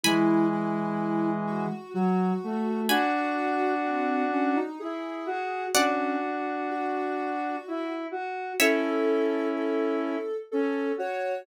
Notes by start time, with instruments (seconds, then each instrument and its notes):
0.04 lead 1 (square) E3 G#3, ocarina E4, harpsichord G#5 B5
0.52 ocarina E4
1.47 ocarina F#4
1.94 lead 1 (square) F#3, ocarina F#4
2.44 lead 1 (square) A3
2.89 lead 1 (square) D4 F#4, ocarina F#4, harpsichord G#5 B5
3.85 ocarina C4
4.32 ocarina C#4
4.56 ocarina D#4
4.80 lead 1 (square) E4, ocarina G#4
5.26 lead 1 (square) F#4
5.74 ocarina C#4, lead 1 (square) D4 F#4, harpsichord D5 F#5
6.70 ocarina F#4
7.68 lead 1 (square) E4
8.11 lead 1 (square) F#4
8.59 lead 1 (square) C#4 E4, ocarina A4, harpsichord C#5 E5
9.56 ocarina A4
10.52 lead 1 (square) C#4, ocarina A4
10.98 lead 1 (square) F#4, ocarina C#5